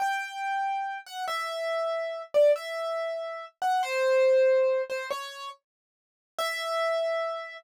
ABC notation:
X:1
M:6/8
L:1/8
Q:3/8=94
K:Em
V:1 name="Acoustic Grand Piano"
g5 f | e5 d | e5 f | c5 c |
^c2 z4 | e6 |]